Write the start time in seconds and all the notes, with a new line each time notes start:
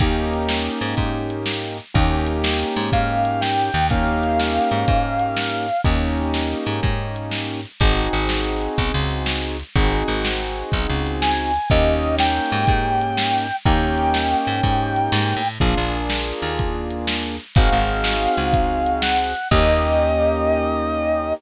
0.00 D#2 A#3 C#4 D#4 G4, kick, closed hi-hat
0.33 closed hi-hat
0.49 snare
0.81 G#2, closed hi-hat
0.97 G#2, kick, closed hi-hat
1.30 closed hi-hat
1.46 snare
1.78 closed hi-hat
1.94 D#2 A#3 C#4 D#4 G4, kick, closed hi-hat
2.26 closed hi-hat
2.44 snare
2.76 G#2, closed hi-hat
2.92 G#2 F5, kick, closed hi-hat
3.25 closed hi-hat
3.41 G5, snare
3.74 D#2, closed hi-hat
3.90 A#3 C#4 D#4 G4 F5, kick, closed hi-hat
4.23 closed hi-hat
4.39 snare
4.71 G#2, closed hi-hat
4.88 G#2, kick, closed hi-hat
5.19 closed hi-hat
5.37 snare
5.69 closed hi-hat
5.84 D#2 A#3 C#4 D#4 G4, kick, closed hi-hat
6.17 closed hi-hat
6.34 snare
6.66 G#2, closed hi-hat
6.83 G#2, kick, closed hi-hat
7.16 closed hi-hat
7.31 snare
7.65 closed hi-hat
7.80 G#1 C4 D#4 F#4 G#4, kick, closed hi-hat
8.13 G#1, closed hi-hat
8.29 snare
8.61 closed hi-hat
8.78 B1, kick, closed hi-hat
8.94 C#2
9.11 closed hi-hat
9.26 snare
9.60 closed hi-hat
9.76 G#1 C4 D#4 F#4 G#4, kick, closed hi-hat
10.08 G#1, closed hi-hat
10.25 snare
10.56 closed hi-hat
10.72 B1, kick, closed hi-hat
10.89 C#2
11.07 closed hi-hat
11.22 G#5, snare
11.54 open hi-hat
11.70 D#2 A#3 C#4 D#4 G4 D#5, kick, closed hi-hat
12.03 closed hi-hat
12.19 G5, snare
12.52 G#2, closed hi-hat
12.67 G#2, kick, closed hi-hat
13.01 closed hi-hat
13.17 snare
13.51 closed hi-hat
13.66 D#2 A#3 C#4 D#4 G4 G5, kick, closed hi-hat
13.98 closed hi-hat
14.14 snare
14.47 G#2, closed hi-hat
14.63 G#2, kick, closed hi-hat
14.96 closed hi-hat
15.12 G#2, snare
15.37 A2
15.45 open hi-hat
15.60 A#1 A#3 D4 F4 G#4, kick, closed hi-hat
15.77 A#1
15.94 closed hi-hat
16.10 snare
16.42 D#2, closed hi-hat
16.59 kick, closed hi-hat
16.90 closed hi-hat
17.07 snare
17.40 closed hi-hat
17.55 G#1 C4 D#4 F#4 G#4 F5, kick, closed hi-hat
17.72 G#1
17.89 closed hi-hat
18.04 snare
18.37 C#2, closed hi-hat
18.53 kick, closed hi-hat
18.86 closed hi-hat
19.02 F#5, snare
19.35 closed hi-hat
19.51 D#2 A#3 C#4 D#4 G4 D#5, kick, crash